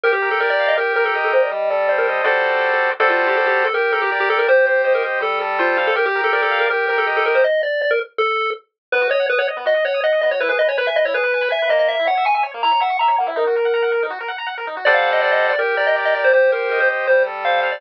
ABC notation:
X:1
M:4/4
L:1/16
Q:1/4=162
K:Gm
V:1 name="Lead 1 (square)"
B G2 A B d2 e B2 B A z A c d | e2 d2 d B z2 A6 z2 | A F2 G A G2 A B2 A G z G A B | c2 c2 c B z2 A2 z2 F2 z A |
B G2 A B A2 B B2 B A z A B c | e2 d2 d B z2 A4 z4 | [K:G#m] B2 c2 B c z2 d2 c2 d2 d c | B B d c B e d c B4 e2 d d |
e2 f2 g g z2 a2 f2 a2 f e | A8 z8 | [K:Gm] d f2 e d e2 d B2 d e z e d c | c2 B2 B c z2 c2 z2 f2 z d |]
V:2 name="Lead 1 (square)"
G2 B2 d2 f2 G2 B2 e2 G2 | G,2 A2 c2 e2 [G,^FAcd]8 | [G,^FAcd]8 G2 B2 d2 G2 | G2 c2 e2 G2 G,2 A2 c2 f2 |
G2 B2 d2 f2 G2 B2 e2 G2 | z16 | [K:G#m] B, F d f d' f d B, F d f d' f d B, F | E G B g b g B E G B g b g B A,2- |
A, E c e c' e c A, E c e c' e c A, E | D F A f a f A D F A f a f A D F | [K:Gm] [G,Acd^f]8 G2 B2 d2 G2 | G2 c2 e2 G2 G,2 A2 c2 f2 |]